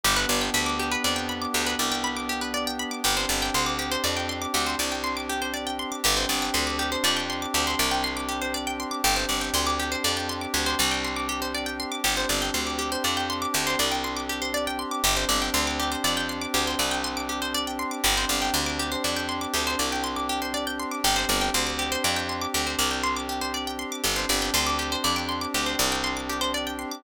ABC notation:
X:1
M:6/8
L:1/16
Q:3/8=80
K:Gmix
V:1 name="Pizzicato Strings"
G B d g b d' G B d g b d' | G B d g b d' G B d g b d' | G c d g c' d' G c d g c' d' | G c d g c' d' G c d g c' d' |
G c d g c' d' G c d g c' d' | G c d g c' d' G c d g c' d' | G c d g c' d' G c d g c' d' | G c d g c' d' G c d g c' d' |
G c d g c' d' G c d g c' d' | G c d g c' d' G c d g c' d' | G c d g c' d' G c d g c' d' | G c d g c' d' G c d g c' d' |
G c d g c' d' G c d g c' d' | G c d g c' d' G c d g c' d' | G c d g c' d' G c d g c' d' | G c d g c' d' G c d g c' d' |
G c d g c' d' G c d g c' d' | G c d g c' d' G c d g c' d' |]
V:2 name="Pad 5 (bowed)"
[B,DG]12- | [B,DG]12 | [CDG]12- | [CDG]12 |
[CDG]12- | [CDG]12 | [CDG]12- | [CDG]12 |
[CDG]12- | [CDG]12 | [CDG]12- | [CDG]12 |
[CDG]12- | [CDG]12 | [CDG]12- | [CDG]12 |
[CDG]12- | [CDG]12 |]
V:3 name="Electric Bass (finger)" clef=bass
G,,,2 G,,,2 D,,4 F,,4 | D,,2 C,,10 | G,,,2 G,,,2 D,,4 F,,4 | D,,2 C,,10 |
G,,,2 G,,,2 D,,4 F,,4 | D,,2 C,,10 | G,,,2 G,,,2 D,,4 F,,4 | D,,2 C,,10 |
G,,,2 G,,,2 D,,4 F,,4 | D,,2 C,,10 | G,,,2 G,,,2 D,,4 F,,4 | D,,2 C,,10 |
G,,,2 G,,,2 D,,4 F,,4 | D,,2 C,,10 | G,,,2 G,,,2 D,,4 F,,4 | D,,2 C,,10 |
G,,,2 G,,,2 D,,4 F,,4 | D,,2 C,,10 |]